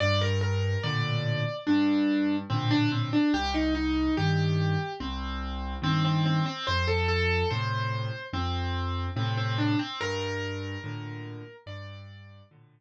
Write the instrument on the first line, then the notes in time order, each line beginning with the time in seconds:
acoustic grand piano
0.00 G2 D5
0.21 A#4
0.41 A#4
0.84 A2 A#2 D3 D5
1.67 G2 D4
2.50 A2 A#2 D3 C4
2.71 D4
2.92 C4
3.13 D4
3.34 C2 G4
3.54 D#4
3.75 D#4
4.17 G2 D#3 G4
5.00 C2 C4
5.82 G2 D#3 C4
6.05 C4
6.26 C4
6.46 C4
6.67 F2 C5
6.87 A4
7.08 A4
7.50 A2 C3 C5
8.33 F2 C4
9.16 A2 C3 C4
9.37 C4
9.58 D4
9.79 C4
10.01 G2 A#4
10.84 A2 A#2 D3
11.66 G2 D5
12.51 A2 A#2 D3